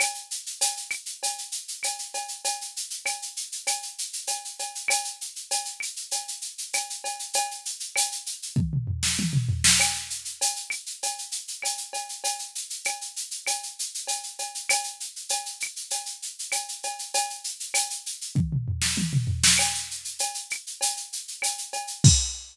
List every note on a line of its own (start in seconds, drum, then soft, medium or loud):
0.00 cowbell medium
0.00 claves medium
0.00 shaker medium
0.14 shaker medium
0.31 shaker medium
0.46 shaker medium
0.61 cowbell medium
0.61 shaker loud
0.77 shaker medium
0.90 claves medium
0.90 shaker medium
1.06 shaker medium
1.23 cowbell medium
1.23 shaker medium
1.38 shaker medium
1.52 shaker medium
1.68 shaker medium
1.83 cowbell medium
1.83 claves medium
1.83 shaker medium
1.99 shaker medium
2.14 cowbell medium
2.14 shaker medium
2.28 shaker medium
2.44 cowbell medium
2.44 shaker medium
2.61 shaker medium
2.76 shaker medium
2.90 shaker medium
3.05 cowbell medium
3.05 claves medium
3.05 shaker medium
3.22 shaker medium
3.36 shaker medium
3.52 shaker medium
3.67 cowbell medium
3.67 claves medium
3.67 shaker medium
3.82 shaker medium
3.98 shaker medium
4.13 shaker medium
4.27 cowbell medium
4.27 shaker medium
4.45 shaker medium
4.59 cowbell medium
4.59 shaker medium
4.75 shaker medium
4.88 cowbell medium
4.88 claves loud
4.88 shaker loud
5.04 shaker medium
5.21 shaker medium
5.36 shaker medium
5.51 cowbell medium
5.51 shaker medium
5.65 shaker medium
5.80 claves medium
5.80 shaker medium
5.96 shaker medium
6.11 cowbell medium
6.11 shaker medium
6.28 shaker medium
6.41 shaker medium
6.58 shaker medium
6.73 cowbell medium
6.73 claves medium
6.73 shaker medium
6.90 shaker medium
7.04 cowbell medium
7.04 shaker medium
7.19 shaker medium
7.33 cowbell medium
7.33 shaker medium
7.51 shaker medium
7.65 shaker medium
7.80 shaker medium
7.96 cowbell medium
7.96 claves medium
7.96 shaker loud
8.12 shaker medium
8.26 shaker medium
8.42 shaker medium
8.56 kick medium
8.56 high tom medium
8.73 mid tom medium
8.87 floor tom medium
9.03 snare medium
9.19 high tom medium
9.33 mid tom medium
9.49 floor tom medium
9.64 snare loud
9.80 cowbell medium
9.80 claves medium
9.80 shaker medium
9.94 shaker medium
10.10 shaker medium
10.25 shaker medium
10.41 cowbell medium
10.41 shaker loud
10.56 shaker medium
10.70 claves medium
10.70 shaker medium
10.86 shaker medium
11.03 cowbell medium
11.03 shaker medium
11.18 shaker medium
11.32 shaker medium
11.48 shaker medium
11.62 cowbell medium
11.62 claves medium
11.62 shaker medium
11.77 shaker medium
11.93 cowbell medium
11.93 shaker medium
12.09 shaker medium
12.24 cowbell medium
12.24 shaker medium
12.39 shaker medium
12.55 shaker medium
12.70 shaker medium
12.85 cowbell medium
12.85 claves medium
12.85 shaker medium
13.01 shaker medium
13.16 shaker medium
13.31 shaker medium
13.47 cowbell medium
13.47 claves medium
13.47 shaker medium
13.63 shaker medium
13.79 shaker medium
13.94 shaker medium
14.07 cowbell medium
14.07 shaker medium
14.23 shaker medium
14.39 cowbell medium
14.39 shaker medium
14.55 shaker medium
14.69 cowbell medium
14.69 claves loud
14.69 shaker loud
14.84 shaker medium
15.00 shaker medium
15.16 shaker medium
15.29 cowbell medium
15.29 shaker medium
15.46 shaker medium
15.60 claves medium
15.60 shaker medium
15.76 shaker medium
15.90 cowbell medium
15.90 shaker medium
16.06 shaker medium
16.22 shaker medium
16.39 shaker medium
16.52 cowbell medium
16.52 claves medium
16.52 shaker medium
16.68 shaker medium
16.83 cowbell medium
16.83 shaker medium
16.99 shaker medium
17.14 cowbell medium
17.14 shaker medium
17.30 shaker medium
17.44 shaker medium
17.60 shaker medium
17.74 cowbell medium
17.74 claves medium
17.74 shaker loud
17.90 shaker medium
18.06 shaker medium
18.21 shaker medium
18.35 kick medium
18.35 high tom medium
18.52 mid tom medium
18.68 floor tom medium
18.82 snare medium
18.97 high tom medium
19.13 mid tom medium
19.27 floor tom medium
19.43 snare loud
19.58 cowbell medium
19.58 claves medium
19.58 shaker medium
19.74 shaker medium
19.91 shaker medium
20.05 shaker medium
20.19 cowbell medium
20.19 shaker medium
20.34 shaker medium
20.50 claves medium
20.50 shaker medium
20.67 shaker medium
20.81 cowbell medium
20.81 shaker loud
20.97 shaker medium
21.13 shaker medium
21.28 shaker medium
21.42 cowbell medium
21.42 claves medium
21.42 shaker medium
21.58 shaker medium
21.73 cowbell medium
21.73 shaker medium
21.87 shaker medium
22.04 kick loud
22.04 crash loud